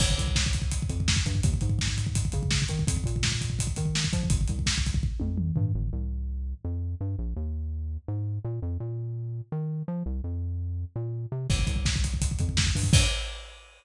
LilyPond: <<
  \new Staff \with { instrumentName = "Synth Bass 1" } { \clef bass \time 4/4 \key g \minor \tempo 4 = 167 g,,8 c,2 f,4 g,8 | ees,8 aes,2 des4 ees8 | f,8 bes,2 ees4 f8 | g,,8 c,2 f,4 g,8 |
g,,8 c,2 f,4 g,8 | bes,,8 ees,2 aes,4 bes,8 | f,8 bes,2 ees4 f8 | c,8 f,2 bes,4 c8 |
g,,8 c,2 f,4 g,8 | g,4 r2. | }
  \new DrumStaff \with { instrumentName = "Drums" } \drummode { \time 4/4 <cymc bd>16 bd16 <hh bd>16 bd16 <bd sn>16 bd16 <hh bd>16 bd16 <hh bd>16 bd16 <hh bd>16 bd16 <bd sn>16 bd16 <hh bd>16 bd16 | <hh bd>16 bd16 <hh bd>16 bd16 <bd sn>16 bd16 <hh bd>16 bd16 <hh bd>16 bd16 <hh bd>16 bd16 <bd sn>16 bd16 <hh bd>16 bd16 | <hh bd>16 bd16 <hh bd>16 bd16 <bd sn>16 bd16 <hh bd>16 bd16 <hh bd>16 bd16 <hh bd>16 bd16 sn16 bd16 <hh bd>16 bd16 | <hh bd>16 bd16 <hh bd>16 bd16 <bd sn>16 bd16 <hh bd>16 bd16 bd8 tommh8 toml8 tomfh8 |
r4 r4 r4 r4 | r4 r4 r4 r4 | r4 r4 r4 r4 | r4 r4 r4 r4 |
<cymc bd>16 bd16 <hh bd>16 bd16 <bd sn>16 bd16 <hh bd>16 bd16 <hh bd>16 bd16 <hh bd>16 bd16 <bd sn>16 bd16 <hho bd>16 bd16 | <cymc bd>4 r4 r4 r4 | }
>>